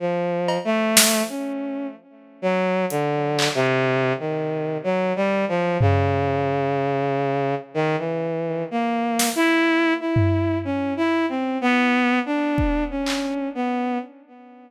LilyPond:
<<
  \new Staff \with { instrumentName = "Violin" } { \time 3/4 \tempo 4 = 62 \tuplet 3/2 { f4 a4 des'4 } r8 ges8 | \tuplet 3/2 { d4 c4 ees4 ges8 g8 f8 } | des2 ees16 e8. | \tuplet 3/2 { bes4 e'4 e'4 des'8 e'8 c'8 } |
\tuplet 3/2 { b4 d'4 des'4 } b8 r8 | }
  \new DrumStaff \with { instrumentName = "Drums" } \drummode { \time 3/4 r8 cb8 sn4 r4 | hh8 hc8 r4 r4 | tomfh4 r4 r4 | r8 sn8 r8 tomfh8 r4 |
r4 bd8 hc8 r4 | }
>>